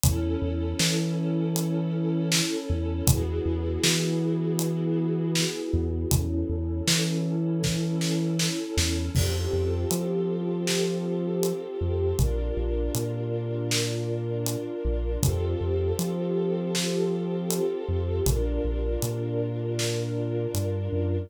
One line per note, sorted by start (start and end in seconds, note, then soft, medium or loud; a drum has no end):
0.03 0.36 E2 loud
0.03 3.04 C#4 medium
0.03 3.04 E4 medium
0.03 3.04 A4 medium
0.03 kick loud
0.03 closed hi-hat loud
0.42 0.74 E2 loud
0.79 2.41 E3 loud
0.79 snare loud
1.56 closed hi-hat medium
2.32 snare loud
2.70 3.02 E2 loud
3.07 3.40 E2 loud
3.07 6.09 B3 medium
3.07 6.09 E4 medium
3.07 6.09 F#4 medium
3.07 6.09 G#4 medium
3.07 kick loud
3.07 closed hi-hat loud
3.46 3.78 E2 loud
3.84 5.45 E3 medium
3.84 snare loud
4.59 closed hi-hat medium
5.35 snare loud
5.73 6.06 E2 loud
6.11 6.44 E2 loud
6.11 9.12 C#4 medium
6.11 9.12 E4 medium
6.11 9.12 A4 medium
6.11 kick medium
6.11 closed hi-hat loud
6.49 6.82 E2 loud
6.87 8.49 E3 loud
6.87 snare loud
7.63 kick medium
7.63 snare medium
8.01 snare medium
8.39 snare loud
8.77 9.09 E2 loud
8.77 snare loud
9.15 9.47 F2 loud
9.15 12.16 C4 medium
9.15 12.16 F4 medium
9.15 12.16 G4 medium
9.15 12.16 A4 medium
9.15 kick medium
9.15 crash medium
9.53 9.85 F2 medium
9.91 11.53 F3 medium
9.91 closed hi-hat loud
10.67 snare loud
11.43 closed hi-hat medium
11.81 12.13 F2 medium
12.19 12.51 A#1 loud
12.19 15.20 D4 medium
12.19 15.20 F4 medium
12.19 15.20 A#4 medium
12.19 kick medium
12.19 closed hi-hat medium
12.57 12.89 A#1 medium
12.95 14.56 A#2 medium
12.95 closed hi-hat medium
13.71 snare loud
14.46 closed hi-hat medium
14.85 15.17 A#1 medium
15.23 15.55 F2 loud
15.23 18.23 C4 medium
15.23 18.23 F4 medium
15.23 18.23 G4 medium
15.23 18.23 A4 medium
15.23 kick medium
15.23 closed hi-hat loud
15.61 15.93 F2 medium
15.99 17.60 F3 medium
15.99 closed hi-hat medium
16.75 snare medium
17.50 closed hi-hat loud
17.89 18.21 F2 medium
18.26 18.59 A#1 loud
18.26 21.28 D4 medium
18.26 21.28 F4 medium
18.26 21.28 A#4 medium
18.26 kick medium
18.26 closed hi-hat medium
18.65 18.97 A#1 medium
19.02 20.47 A#2 loud
19.02 closed hi-hat medium
19.79 snare medium
20.54 20.89 G2 medium
20.54 closed hi-hat medium
20.92 21.27 F#2 medium